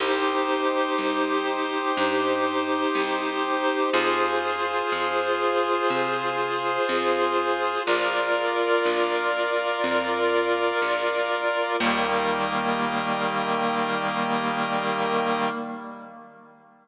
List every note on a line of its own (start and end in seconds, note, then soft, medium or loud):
0.00 0.89 C2 medium
0.00 3.90 D#4 medium
0.00 3.90 G4 medium
0.00 3.90 C5 loud
0.00 3.90 C5 medium
0.00 3.90 D#5 medium
0.98 1.87 C2 medium
1.97 2.85 G2 medium
2.95 3.84 C2 medium
3.93 4.82 F2 loud
3.93 7.82 F4 medium
3.93 7.83 F4 loud
3.93 7.82 G#4 medium
3.93 7.83 G#4 loud
3.93 7.82 C5 medium
3.93 7.83 C5 medium
4.92 5.81 F2 medium
5.90 6.79 C3 medium
6.89 7.77 F2 medium
7.87 8.75 A#1 loud
7.87 11.76 F4 medium
7.87 11.76 F4 loud
7.87 11.76 A#4 medium
7.87 11.76 A#4 loud
7.87 11.76 D5 medium
7.87 11.76 D5 loud
8.85 9.74 A#1 medium
9.84 10.72 F2 medium
10.82 11.70 A#1 medium
11.80 15.49 D#2 loud
11.80 15.49 D#3 loud
11.80 15.49 G3 medium
11.80 15.49 A#3 medium
11.80 15.49 G4 loud
11.80 15.49 A#4 loud
11.80 15.49 D#5 loud